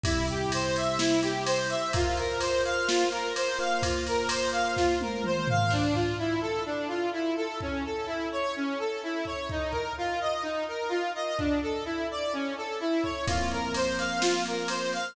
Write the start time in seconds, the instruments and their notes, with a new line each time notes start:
0.03 electric piano 1 C3 G3 E4, lead 1 (square) E4, kick, ride
0.28 lead 1 (square) G4, ride
0.52 lead 1 (square) C5, ride
0.76 lead 1 (square) E5, ride
0.99 lead 1 (square) E4, snare
1.23 lead 1 (square) G4, ride
1.45 lead 1 (square) C5, ride
1.70 lead 1 (square) E5, ride
1.93 electric piano 1 F4 A#4 C5, lead 1 (square) F4, kick, ride
2.17 lead 1 (square) A#4, ride
2.40 lead 1 (square) C5, ride
2.65 lead 1 (square) F5, ride
2.87 lead 1 (square) F4, snare
3.11 lead 1 (square) A#4, ride
3.35 lead 1 (square) C5, ride
3.59 electric piano 1 A#3 F4 C5, lead 1 (square) F5, ride
3.82 lead 1 (square) F4, kick, ride
4.06 lead 1 (square) A#4, ride
4.28 lead 1 (square) C5, ride
4.52 lead 1 (square) F5, ride
4.76 lead 1 (square) F4, kick, snare
5.01 lead 1 (square) A#4, high tom
5.24 lead 1 (square) C5, mid tom
5.48 lead 1 (square) F5, floor tom
5.70 lead 1 (square) D4, kick, crash
5.94 lead 1 (square) F4, kick
6.19 lead 1 (square) E4
6.41 lead 1 (square) A4
6.66 lead 1 (square) D4
6.88 lead 1 (square) F4
7.13 lead 1 (square) E4
7.36 lead 1 (square) A4
7.61 lead 1 (square) C#4, kick
7.85 lead 1 (square) A4
8.07 lead 1 (square) E4
8.32 lead 1 (square) C#5
8.56 lead 1 (square) C#4
8.79 lead 1 (square) A4
9.03 lead 1 (square) E4
9.25 lead 1 (square) C#5, kick
9.50 lead 1 (square) D#4, kick
9.71 lead 1 (square) A#4, kick
9.98 lead 1 (square) F4
10.21 lead 1 (square) D#5
10.42 lead 1 (square) D#4
10.68 lead 1 (square) A#4
10.89 lead 1 (square) F4
11.15 lead 1 (square) D#5
11.38 lead 1 (square) D4, kick
11.62 lead 1 (square) A4
11.85 lead 1 (square) E4
12.11 lead 1 (square) D5
12.33 lead 1 (square) C#4
12.57 lead 1 (square) A4
12.80 lead 1 (square) E4
13.03 lead 1 (square) C#5, kick
13.27 electric piano 1 F3 A#3 C4, lead 1 (square) F4, kick, ride
13.51 lead 1 (square) A#4, ride
13.74 lead 1 (square) C5, ride
13.98 lead 1 (square) F5, ride
14.21 lead 1 (square) F4, snare
14.45 lead 1 (square) A#4, ride
14.68 lead 1 (square) C5, ride
14.93 lead 1 (square) F5, ride